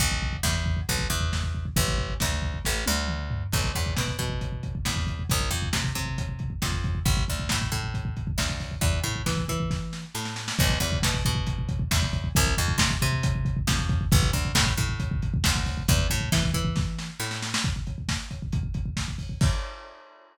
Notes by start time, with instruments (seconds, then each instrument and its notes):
0.00 electric bass (finger) B1, kick, closed hi-hat
0.12 kick
0.22 kick
0.33 kick
0.43 electric bass (finger) E2, kick, snare
0.55 kick
0.66 kick
0.77 kick
0.89 electric bass (finger) B1, kick, closed hi-hat
0.99 kick
1.10 electric bass (finger) E2, kick
1.20 kick
1.33 kick, snare
1.43 kick
1.55 kick
1.65 kick
1.76 electric bass (finger) A1, kick, closed hi-hat
1.88 kick
1.98 kick
2.10 kick
2.20 electric bass (finger) D2, kick, snare
2.31 kick
2.42 kick
2.54 kick
2.65 electric bass (finger) A1, kick, snare
2.86 electric bass (finger) D2, high tom
3.08 mid tom
3.31 floor tom
3.52 electric bass (finger) B1, kick, crash
3.64 kick
3.75 electric bass (finger) E2, kick, closed hi-hat
3.86 kick
3.97 electric bass (finger) B2, kick, snare
4.08 kick
4.19 electric bass (finger) B2, kick, closed hi-hat
4.30 kick
4.41 kick, closed hi-hat
4.52 kick
4.63 kick, closed hi-hat
4.75 kick
4.85 electric bass (finger) E2, kick, snare
4.96 kick
5.07 kick, closed hi-hat
5.19 kick
5.30 electric bass (finger) C2, kick, closed hi-hat
5.41 kick
5.51 electric bass (finger) F2, kick, closed hi-hat
5.62 kick
5.73 electric bass (finger) C3, kick, snare
5.84 kick
5.95 electric bass (finger) C3, kick, closed hi-hat
6.06 kick
6.18 kick, closed hi-hat
6.29 kick
6.39 kick, closed hi-hat
6.50 kick
6.62 electric bass (finger) F2, kick, snare
6.72 kick
6.84 kick, closed hi-hat
6.95 kick
7.06 electric bass (finger) A1, kick, closed hi-hat
7.17 kick
7.28 electric bass (finger) D2, kick, closed hi-hat
7.40 kick
7.49 electric bass (finger) A2, kick, snare
7.62 kick
7.72 electric bass (finger) A2, kick, closed hi-hat
7.84 kick
7.94 kick, closed hi-hat
8.05 kick
8.17 kick, closed hi-hat
8.27 kick
8.38 electric bass (finger) D2, kick, snare
8.49 kick
8.60 kick, open hi-hat
8.71 kick
8.81 electric bass (finger) E2, kick, closed hi-hat
8.93 kick
9.03 electric bass (finger) A2, kick, closed hi-hat
9.16 kick
9.26 electric bass (finger) E3, kick, snare
9.37 kick
9.48 electric bass (finger) E3, kick, closed hi-hat
9.60 kick
9.70 kick, snare
9.93 snare
10.15 electric bass (finger) A2, snare
10.25 snare
10.36 snare
10.48 snare
10.59 electric bass (finger) B1, kick, crash
10.70 kick
10.80 electric bass (finger) E2, kick, closed hi-hat
10.92 kick
11.02 electric bass (finger) B2, kick, snare
11.14 kick
11.25 electric bass (finger) B2, kick, closed hi-hat
11.35 kick
11.47 kick, closed hi-hat
11.59 kick
11.69 kick, closed hi-hat
11.79 kick
11.91 electric bass (finger) E2, kick, snare
12.02 kick
12.13 kick, closed hi-hat
12.24 kick
12.35 electric bass (finger) C2, kick, closed hi-hat
12.47 kick
12.57 electric bass (finger) F2, kick, closed hi-hat
12.68 kick
12.78 electric bass (finger) C3, kick, snare
12.91 kick
13.02 electric bass (finger) C3, kick, closed hi-hat
13.12 kick
13.23 kick, closed hi-hat
13.35 kick
13.45 kick, closed hi-hat
13.57 kick
13.67 electric bass (finger) F2, kick, snare
13.79 kick
13.89 kick, closed hi-hat
14.01 kick
14.12 electric bass (finger) A1, kick, closed hi-hat
14.23 kick
14.33 electric bass (finger) D2, kick, closed hi-hat
14.45 kick
14.55 electric bass (finger) A2, kick, snare
14.66 kick
14.77 electric bass (finger) A2, kick, closed hi-hat
14.89 kick
15.00 kick, closed hi-hat
15.11 kick
15.22 kick, closed hi-hat
15.34 kick
15.44 electric bass (finger) D2, kick, snare
15.56 kick
15.65 kick, open hi-hat
15.77 kick
15.88 electric bass (finger) E2, kick, closed hi-hat
15.99 kick
16.10 electric bass (finger) A2, kick, closed hi-hat
16.21 kick
16.32 electric bass (finger) E3, kick, snare
16.43 kick
16.54 electric bass (finger) E3, kick, closed hi-hat
16.65 kick
16.76 kick, snare
16.99 snare
17.20 electric bass (finger) A2, snare
17.31 snare
17.42 snare
17.54 snare
17.64 kick, closed hi-hat
17.76 kick
17.87 kick, closed hi-hat
17.98 kick
18.09 kick, snare
18.31 kick, closed hi-hat
18.42 kick
18.52 kick, closed hi-hat
18.63 kick
18.74 kick, closed hi-hat
18.86 kick
18.97 kick, snare
19.08 kick
19.18 kick, open hi-hat
19.29 kick
19.41 kick, crash